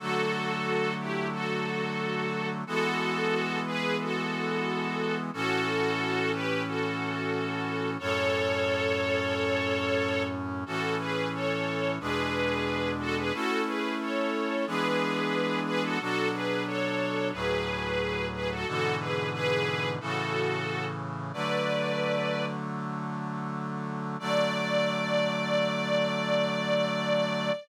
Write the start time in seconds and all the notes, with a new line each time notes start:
0.00 D3 F#3 A3 F#4 A4
1.00 E4 G4
1.32 F#4 A4
2.67 E3 G#3 B3 F#4 A4
3.66 G#4 B4
4.01 F#4 A4
5.33 A2 E3 C#4 F#4 A4
6.33 G4 B4
6.67 F#4 A4
7.99 F#2 A2 C#4 A4 C#5
10.66 A2 E3 C#4 F#4 A4
11.00 G#4 B4
11.34 A4 C#5
12.00 E2 B2 G#3 D4 G#4 B4
13.00 F#4 A4
13.17 G#4 B4
13.33 A3 C#4 E4 F#4 A4
13.67 G#4 B4
14.00 A4 C#5
14.67 E3 G#3 B3 D4 G#4 B4
15.66 G#4 B4
15.83 F#4 A4
16.00 B2 F#3 D4 F#4 A4
16.33 G#4 B4
16.67 A4 C#5
17.32 D2 A2 F#3 G#4 B4
18.33 G#4 B4
18.51 F#4 A4
18.67 G#2 B2 D3 E3 F#4 A4
18.99 G#4 B4
19.33 G#4 B4
20.00 A2 C#3 E3 F#4 A4
21.33 D3 F#3 A3 B4 D5
24.19 D3 F#3 A3 D5